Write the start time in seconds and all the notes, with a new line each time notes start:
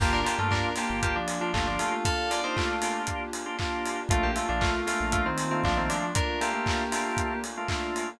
0.00 G1 A#3 D4 F4 G4, kick, crash
0.13 D4 A#4
0.25 A#3 D4 F4 G4, open hi-hat
0.38 G2 A3 A#3 D4 F4 G4
0.51 D4 A#4, kick, clap
0.76 A#3 D4 F4 G4, snare, open hi-hat
0.90 G1
1.03 A#3 G4, kick, closed hi-hat
1.16 F3 D4
1.28 open hi-hat
1.41 F3 A#3 D4 F4 G4
1.53 G1 A3 A#3 D4 F4 G4, kick, clap
1.67 F3 D4
1.79 A3 F4, open hi-hat
2.05 A4 F5, kick, closed hi-hat
2.30 A#3 D4 F4 G4 D5, open hi-hat
2.44 A#3 D4 D#4 F4 G4 C5
2.56 A3 F4, kick, clap
2.82 A#3 D4 F4 G4, snare, open hi-hat
3.07 kick, closed hi-hat
3.33 open hi-hat
3.46 A#3 D4 F4 G4
3.59 A#3 D4 F4 G4, kick, clap
3.85 open hi-hat
4.09 A#1 A3 A#3 D4 F4, kick, closed hi-hat
4.23 A#3 G4
4.36 A3 A#3 D4 F4, open hi-hat
4.49 A#1 F3 A3 A#3 D4 F4
4.61 A3 F4, kick, clap
4.86 A3 A#3 D4 F4, snare, open hi-hat
5.00 A#1
5.12 A3 F4, kick, closed hi-hat
5.26 D#3 C4
5.38 open hi-hat
5.51 D#3 A3 A#3 C4 D4 F4
5.64 A#1 F3 A3 A#3 D4 F4, kick, clap
5.77 D#3 C4
5.90 F3 D4, open hi-hat
6.15 D4 A#4, kick, closed hi-hat
6.41 A3 A#3 D4 F4 G4, open hi-hat
6.53 A3 A#3 D4 F4
6.66 kick, clap
6.92 A3 A#3 D4 F4, snare, open hi-hat
7.17 kick, closed hi-hat
7.44 open hi-hat
7.57 A3 A#3 D4 F4
7.68 A3 A#3 D4 F4, kick, clap
7.96 open hi-hat